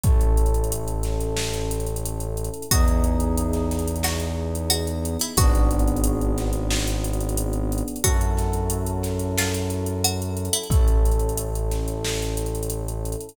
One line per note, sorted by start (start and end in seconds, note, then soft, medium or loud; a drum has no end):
0.03 2.49 A1 medium
0.03 2.65 C#4 loud
0.03 2.65 E4 medium
0.03 2.65 A4 medium
0.03 kick medium
0.03 closed hi-hat medium
0.21 closed hi-hat medium
0.37 closed hi-hat medium
0.46 closed hi-hat medium
0.54 closed hi-hat medium
0.64 closed hi-hat medium
0.72 closed hi-hat medium
0.88 closed hi-hat medium
1.03 snare soft
1.03 closed hi-hat medium
1.20 closed hi-hat medium
1.37 snare medium
1.53 closed hi-hat medium
1.71 closed hi-hat medium
1.80 closed hi-hat medium
1.86 closed hi-hat medium
1.96 closed hi-hat medium
2.05 closed hi-hat medium
2.20 closed hi-hat medium
2.37 closed hi-hat medium
2.44 closed hi-hat medium
2.54 closed hi-hat medium
2.62 closed hi-hat medium
2.71 5.17 E2 medium
2.71 5.33 B3 medium
2.71 5.33 D#4 medium
2.71 5.33 E4 medium
2.71 2.87 F#4 medium
2.71 5.33 G#4 medium
2.71 kick medium
2.71 closed hi-hat medium
2.88 closed hi-hat medium
3.04 closed hi-hat medium
3.20 closed hi-hat medium
3.37 closed hi-hat medium
3.53 snare soft
3.53 closed hi-hat medium
3.71 snare soft
3.71 closed hi-hat medium
3.79 closed hi-hat medium
3.88 closed hi-hat medium
3.96 closed hi-hat medium
4.03 4.69 F#4 medium
4.03 snare medium
4.20 closed hi-hat medium
4.55 closed hi-hat medium
4.70 4.86 F#4 medium
4.70 closed hi-hat medium
4.87 closed hi-hat medium
5.05 closed hi-hat medium
5.19 5.37 E4 medium
5.19 snare soft
5.19 closed hi-hat medium
5.37 7.83 G#1 medium
5.37 7.98 B3 loud
5.37 7.98 D4 loud
5.37 7.98 F#4 medium
5.37 6.58 F#4 medium
5.37 7.98 G#4 medium
5.37 kick medium
5.37 closed hi-hat medium
5.55 closed hi-hat medium
5.71 closed hi-hat medium
5.79 closed hi-hat medium
5.88 closed hi-hat medium
5.96 closed hi-hat medium
6.04 closed hi-hat medium
6.21 closed hi-hat soft
6.38 snare soft
6.38 closed hi-hat medium
6.53 closed hi-hat medium
6.70 snare medium
6.87 closed hi-hat medium
7.04 closed hi-hat medium
7.13 closed hi-hat medium
7.20 closed hi-hat medium
7.29 closed hi-hat medium
7.37 closed hi-hat medium
7.53 closed hi-hat medium
7.72 closed hi-hat medium
7.78 closed hi-hat medium
7.88 closed hi-hat medium
7.96 closed hi-hat medium
8.04 10.49 F#2 medium
8.04 10.65 C#4 medium
8.04 10.65 E4 medium
8.04 10.65 F#4 medium
8.04 8.20 F#4 medium
8.04 10.65 A4 medium
8.04 kick medium
8.04 closed hi-hat medium
8.21 closed hi-hat medium
8.37 snare soft
8.37 closed hi-hat medium
8.53 closed hi-hat medium
8.70 closed hi-hat medium
8.86 closed hi-hat medium
9.03 snare soft
9.03 closed hi-hat medium
9.19 closed hi-hat medium
9.38 9.94 F4 medium
9.38 snare medium
9.54 closed hi-hat medium
9.70 closed hi-hat medium
9.86 closed hi-hat medium
10.04 10.20 F#4 medium
10.04 closed hi-hat medium
10.22 closed hi-hat medium
10.37 closed hi-hat medium
10.45 closed hi-hat medium
10.53 10.69 E4 medium
10.53 closed hi-hat medium
10.63 closed hi-hat medium
10.70 13.15 A1 medium
10.70 13.31 C#4 loud
10.70 13.31 E4 medium
10.70 13.31 A4 medium
10.70 kick medium
10.70 closed hi-hat medium
10.88 closed hi-hat medium
11.05 closed hi-hat medium
11.11 closed hi-hat medium
11.19 closed hi-hat medium
11.29 closed hi-hat medium
11.37 closed hi-hat medium
11.55 closed hi-hat medium
11.71 snare soft
11.71 closed hi-hat medium
11.88 closed hi-hat medium
12.04 snare medium
12.22 closed hi-hat medium
12.37 closed hi-hat medium
12.46 closed hi-hat medium
12.55 closed hi-hat medium
12.63 closed hi-hat medium
12.70 closed hi-hat medium
12.88 closed hi-hat medium
13.05 closed hi-hat medium
13.12 closed hi-hat medium
13.20 closed hi-hat medium
13.29 closed hi-hat medium